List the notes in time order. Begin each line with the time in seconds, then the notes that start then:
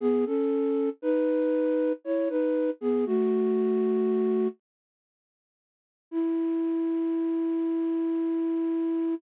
0.00 B3 G#4
0.26 C#4 A4
1.02 D#4 B4
2.04 E4 C#5
2.29 D#4 B4
2.81 B3 G#4
3.06 A3 F#4
6.11 E4